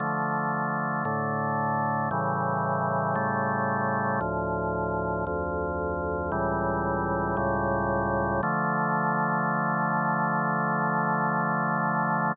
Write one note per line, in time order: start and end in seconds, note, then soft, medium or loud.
0.00 1.04 D3 medium
0.00 1.04 F3 medium
0.00 1.04 A3 loud
1.05 2.09 A2 medium
1.05 2.09 D3 loud
1.05 2.09 A3 medium
2.11 3.15 A2 medium
2.11 3.15 C#3 medium
2.11 3.15 E3 loud
2.11 3.15 G3 medium
3.15 4.20 A2 medium
3.15 4.20 C#3 medium
3.15 4.20 G3 loud
3.15 4.20 A3 medium
4.21 5.25 D2 medium
4.21 5.25 A2 medium
4.21 5.25 F3 medium
5.27 6.31 D2 loud
5.27 6.31 F2 loud
5.27 6.31 F3 medium
6.32 7.36 C#2 loud
6.32 7.36 A2 medium
6.32 7.36 E3 medium
6.32 7.36 G3 medium
7.37 8.41 C#2 loud
7.37 8.41 A2 loud
7.37 8.41 C#3 medium
7.37 8.41 G3 loud
8.43 12.32 D3 loud
8.43 12.32 F3 loud
8.43 12.32 A3 loud